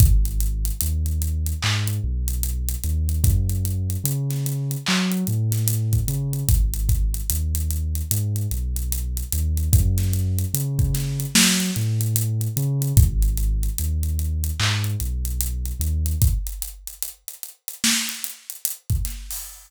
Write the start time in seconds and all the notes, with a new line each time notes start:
0.00 G#1, kick, closed hi-hat
0.25 closed hi-hat
0.40 closed hi-hat
0.65 closed hi-hat
0.81 D#2, closed hi-hat
1.06 closed hi-hat
1.22 closed hi-hat
1.46 closed hi-hat
1.63 G#2, clap
1.88 closed hi-hat
2.04 B1
2.28 closed hi-hat
2.43 closed hi-hat
2.69 closed hi-hat
2.84 D#2, closed hi-hat
3.09 closed hi-hat
3.24 F#2, kick, closed hi-hat
3.49 closed hi-hat
3.65 closed hi-hat
3.90 closed hi-hat
4.04 C#3, closed hi-hat
4.30 snare, closed hi-hat
4.46 closed hi-hat
4.71 closed hi-hat
4.86 F#3, clap
5.11 closed hi-hat
5.27 A2, closed hi-hat
5.52 snare, closed hi-hat
5.68 closed hi-hat
5.93 kick, closed hi-hat
6.08 C#3, closed hi-hat
6.33 closed hi-hat
6.49 G#1, kick, closed hi-hat
6.74 closed hi-hat
6.89 kick, closed hi-hat
7.14 closed hi-hat
7.30 D#2, closed hi-hat
7.55 closed hi-hat
7.70 closed hi-hat
7.95 closed hi-hat
8.11 G#2, closed hi-hat
8.36 closed hi-hat
8.51 B1, closed hi-hat
8.76 closed hi-hat
8.92 closed hi-hat
9.17 closed hi-hat
9.32 D#2, closed hi-hat
9.57 closed hi-hat
9.73 F#2, kick, closed hi-hat
9.98 snare, closed hi-hat
10.13 closed hi-hat
10.39 closed hi-hat
10.54 C#3, closed hi-hat
10.79 kick, closed hi-hat
10.94 snare, closed hi-hat
11.20 closed hi-hat
11.35 F#3, snare
11.60 closed hi-hat
11.76 A2, closed hi-hat
12.01 closed hi-hat
12.16 closed hi-hat
12.41 closed hi-hat
12.57 C#3, closed hi-hat
12.82 closed hi-hat
12.97 G#1, kick, closed hi-hat
13.22 closed hi-hat
13.37 closed hi-hat
13.63 closed hi-hat
13.78 D#2, closed hi-hat
14.03 closed hi-hat
14.19 closed hi-hat
14.44 closed hi-hat
14.60 G#2, clap
14.84 closed hi-hat
15.00 B1, closed hi-hat
15.25 closed hi-hat
15.41 closed hi-hat
15.66 closed hi-hat
15.79 D#2, closed hi-hat
16.06 closed hi-hat
16.22 kick, closed hi-hat
16.47 closed hi-hat
16.62 closed hi-hat
16.87 closed hi-hat
17.03 closed hi-hat
17.28 closed hi-hat
17.43 closed hi-hat
17.68 closed hi-hat
17.84 snare
18.09 closed hi-hat
18.24 closed hi-hat
18.50 closed hi-hat
18.65 closed hi-hat
18.90 kick, closed hi-hat
19.05 snare, closed hi-hat
19.31 open hi-hat